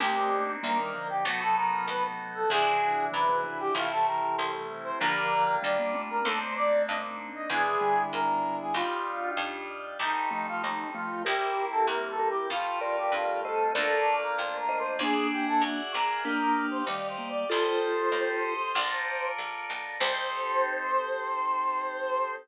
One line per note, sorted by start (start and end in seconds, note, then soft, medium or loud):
0.00 0.57 C2 medium
0.00 0.55 A3 medium
0.00 1.22 A#3 loud
0.00 1.22 C4 medium
0.00 0.55 C4 medium
0.00 1.22 D4 medium
0.00 1.22 D#4 medium
0.00 0.52 G4 medium
0.63 1.20 D2 medium
0.63 0.78 G3 medium
0.63 0.78 A#3 medium
0.63 1.08 A#4 medium
0.78 0.93 D#3 medium
0.78 0.93 G3 medium
0.94 1.23 D3 medium
0.94 1.23 F3 medium
1.09 1.24 G4 medium
1.25 1.81 B1 medium
1.25 2.43 C3 medium
1.25 2.43 F#3 medium
1.25 2.48 A3 medium
1.25 2.48 B3 loud
1.25 2.48 D#4 medium
1.25 1.40 F#4 medium
1.25 2.48 F#4 loud
1.41 1.56 A4 medium
1.56 1.86 A#4 medium
1.88 2.44 D#2 medium
1.88 2.03 B4 medium
2.35 2.49 A4 medium
2.49 3.07 E2 medium
2.49 3.08 C3 medium
2.49 3.08 E3 medium
2.49 3.72 G#3 medium
2.49 3.72 D4 loud
2.49 3.72 E4 loud
2.49 3.72 F#4 medium
2.49 3.05 G#4 medium
3.12 3.70 F#2 medium
3.12 3.26 C3 medium
3.12 3.26 E3 medium
3.12 3.58 B4 medium
3.29 3.43 C3 medium
3.29 3.43 E3 medium
3.43 3.69 C3 medium
3.43 3.69 E3 medium
3.60 3.74 G4 medium
3.74 4.31 A1 medium
3.74 4.92 C3 medium
3.74 4.92 E3 medium
3.74 4.98 G3 loud
3.74 4.98 A3 loud
3.74 4.98 C4 loud
3.74 4.98 E4 medium
3.74 3.90 F4 medium
3.91 4.06 A4 medium
4.06 4.35 A#4 medium
4.37 4.95 C2 medium
4.37 4.52 C5 medium
4.84 4.99 C5 medium
5.00 5.57 A#1 medium
5.00 5.56 D3 medium
5.00 5.56 F3 medium
5.00 6.23 G3 loud
5.00 6.23 A#3 loud
5.00 6.23 D4 loud
5.00 6.23 F4 loud
5.00 5.55 A#4 medium
5.62 6.20 D2 medium
5.62 5.77 D#3 medium
5.62 5.77 G3 medium
5.62 6.02 D5 medium
5.79 5.94 G3 medium
5.79 5.94 A#3 medium
5.94 6.21 A3 medium
5.94 6.21 C4 medium
6.10 6.25 A#4 medium
6.24 6.81 D#2 medium
6.24 7.30 A3 medium
6.24 7.47 A#3 medium
6.24 7.47 C4 loud
6.24 7.30 C4 medium
6.24 7.47 D4 loud
6.24 7.47 D#4 medium
6.24 6.39 A4 medium
6.39 6.54 C5 medium
6.56 6.82 D5 medium
6.87 7.45 G2 medium
6.87 7.02 D#5 medium
7.35 7.50 D#5 medium
7.49 8.06 E2 medium
7.49 7.76 B2 medium
7.49 7.76 E3 medium
7.49 8.73 G#3 loud
7.49 8.73 B3 medium
7.49 8.73 D4 loud
7.49 8.73 E4 loud
7.49 8.03 G#4 loud
7.81 8.82 D3 medium
7.81 8.82 G3 medium
8.12 8.69 G#2 medium
8.12 8.56 A#4 medium
8.60 8.75 G#4 medium
8.74 9.30 D#2 medium
8.74 9.97 G3 loud
8.74 9.97 D4 medium
8.74 9.97 D#4 medium
8.74 9.31 F4 medium
8.74 9.97 F4 medium
9.37 9.93 F2 medium
9.99 10.55 C2 medium
9.99 11.22 G3 medium
9.99 11.22 A3 medium
9.99 11.22 C4 medium
9.99 11.22 D#4 medium
9.99 10.30 D#4 medium
10.31 10.85 F3 medium
10.31 10.85 A3 medium
10.31 10.46 D#4 medium
10.48 10.62 F4 medium
10.62 11.20 D#2 medium
10.62 10.88 D#4 medium
10.94 11.24 F3 medium
10.94 11.24 A3 medium
10.94 11.23 F4 medium
11.25 11.82 C2 medium
11.25 12.48 G3 loud
11.25 12.48 A#3 medium
11.25 12.48 C4 medium
11.25 12.48 E4 medium
11.25 12.13 G4 medium
11.25 11.65 G4 medium
11.25 12.13 A#4 medium
11.71 11.86 A4 medium
11.87 12.43 E2 medium
11.87 12.08 A#4 medium
12.09 12.28 A4 medium
12.19 12.47 G4 medium
12.19 12.47 A#4 medium
12.30 12.49 G4 medium
12.50 13.06 F2 medium
12.50 13.73 G3 loud
12.50 13.73 A3 loud
12.50 13.73 C4 medium
12.50 12.79 F4 medium
12.50 13.73 F4 loud
12.81 12.97 F4 medium
12.81 13.39 A#4 medium
12.81 13.39 D5 medium
12.98 13.13 G4 medium
13.12 13.68 G2 medium
13.12 13.41 F4 medium
13.43 13.73 A4 medium
13.43 13.72 C5 medium
13.43 13.72 D#5 medium
13.74 14.31 D2 medium
13.74 14.97 A3 medium
13.74 14.97 A#3 medium
13.74 14.97 D4 medium
13.74 14.97 F4 loud
13.74 14.15 A4 medium
13.74 14.56 A#4 medium
13.74 14.56 D5 medium
14.22 14.37 A#4 medium
14.37 14.94 F2 medium
14.37 14.57 C5 medium
14.59 14.79 A#4 medium
14.69 14.99 C5 medium
14.69 14.99 D#5 medium
14.79 14.99 C5 medium
14.99 15.55 E2 medium
14.99 15.80 A#3 medium
14.99 15.80 D4 medium
14.99 16.22 G#4 loud
14.99 15.27 G#4 medium
14.99 16.22 D5 loud
14.99 16.22 E5 medium
14.99 16.22 F#5 medium
15.32 15.46 G4 medium
15.48 15.62 A4 medium
15.61 15.91 F#2 medium
15.61 15.92 F#4 medium
15.94 16.82 A#1 medium
15.94 16.24 A#4 medium
16.24 16.82 A#3 medium
16.24 16.82 D4 medium
16.24 17.47 G4 medium
16.24 16.67 A#4 medium
16.24 17.47 D5 medium
16.24 17.47 D#5 medium
16.24 17.47 F5 medium
16.71 16.85 C5 medium
16.87 17.43 D2 medium
16.87 17.17 D#3 medium
16.87 17.17 G3 medium
16.87 17.07 D5 medium
17.09 17.29 C5 medium
17.18 17.44 G3 medium
17.18 17.44 A#3 medium
17.30 17.49 D5 medium
17.49 18.08 C2 medium
17.49 18.54 F4 medium
17.49 18.73 G4 loud
17.49 18.54 A4 medium
17.49 18.73 A4 medium
17.49 18.73 C5 loud
17.49 19.28 C5 medium
17.49 18.73 D#5 medium
18.12 18.68 D#2 medium
18.75 19.31 A#1 medium
18.75 19.98 F4 medium
18.75 19.98 A4 medium
18.75 19.98 A#4 medium
18.75 19.98 D5 medium
19.38 19.66 A#1 medium
19.69 19.98 B1 medium
19.99 22.36 C2 loud
19.99 22.36 C4 loud
19.99 22.36 D#4 medium
19.99 22.36 G4 medium
19.99 22.36 A4 medium
19.99 22.35 C5 loud
19.99 22.37 C5 loud